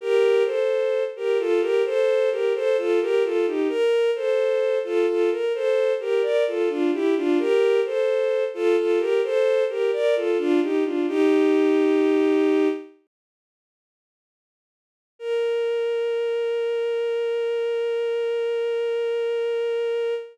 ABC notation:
X:1
M:4/4
L:1/16
Q:1/4=65
K:Bb
V:1 name="Violin"
[GB]2 [Ac]3 [GB] [FA] [GB] [Ac]2 [GB] [Ac] [FA] [GB] [FA] [EG] | B2 [Ac]3 [FA] [FA] B [Ac]2 [GB] [Bd] [FA] [DF] [=EG] [DF] | [GB]2 [Ac]3 [FA] [FA] [GB] [Ac]2 [GB] [Bd] [FA] [DF] [EG] [DF] | "^rit." [EG]8 z8 |
B16 |]